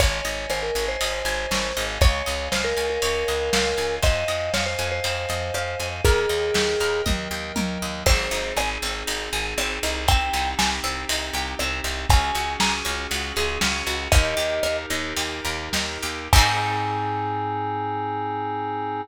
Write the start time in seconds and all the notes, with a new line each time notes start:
0.00 G#1 C#5 D#5 G#5, kick, ride
0.25 G#1 D#5, ride
0.50 G#1 C5 G#5, cross-stick
0.63 A#4
0.75 G#1 C#5, ride
0.88 C5
1.01 G#1 D#5, ride
1.25 G#1 G#5, ride
1.51 G#1 C#5, snare
1.77 G#1 C#5 D#5 F5 G#5, ride
2.01 C#2 C#5, kick, ride
2.26 C#2 D#5, ride
2.52 C#2 C5 F5, snare
2.64 A#4
2.77 C#2 G#5, ride
2.90 A#4
3.02 C#2 C#5, ride
3.28 C#2 D#5, ride
3.53 C#2 F5, snare
3.78 C#2 G#5, ride
4.03 F2 C5 D#5 F5 G#5, kick, ride
4.28 F2 D#5, ride
4.54 F2 C#5 F5, snare
4.66 C5
4.79 F2 G#5, ride
4.92 C5
5.04 F2 C5, ride
5.29 F2 D#5, ride
5.54 F2 F5, cross-stick
5.80 F2 G#5, ride
6.04 D#2 G#4 A#4 D#5 G5, kick, ride
6.29 D#2 D#5, ride
6.54 D#2 G5, snare
6.80 D#2 A#4, ride
7.06 D#2 D#5, kick, high tom
7.31 D#2 G5
7.56 D#2 A#4, high tom
7.82 D#2 D#5
8.06 G#1 C4 D#4 G#4 C5, kick, crash
8.31 G#1 D#4, ride
8.57 G#1 G#4 G#5, cross-stick
8.82 G#1 C4, ride
9.07 G#1 D#4, ride
9.33 G#1 G#4, ride
9.58 G#1 C4, cross-stick
9.83 C2 D#4, ride
10.08 C4 D#4 G4 G5, kick, ride
10.33 C2 D#4, ride
10.59 C2 G4 G#5, snare
10.84 C2 C4, ride
11.09 C2 D#4, ride
11.33 C2 G4, ride
11.59 C2 C4, cross-stick
11.84 C2 D#4, ride
12.10 C#2 C#4 F#4 G#4 G#5, kick, ride
12.35 C#2 F#4, ride
12.60 C#2 G#4 A#5, snare
12.85 C#2 C#4, ride
13.11 C#2 F#4, ride
13.36 C#2 G#4, ride
13.61 C#2 C#4, snare
13.86 C#2 F#4, ride
14.12 D#2 D#4 G4 A#4 D#5, kick, ride
14.37 D#2 G4, ride
14.63 D#2 A#4, cross-stick
14.90 D#2 D#4, ride
15.16 D#2 G4, ride
15.45 D#2 A#4, ride
15.73 D#2 D#4, snare
16.02 D#2 G4, ride
16.33 G#2 C4 D#4 G#4 G#5, kick, crash
16.38 G#4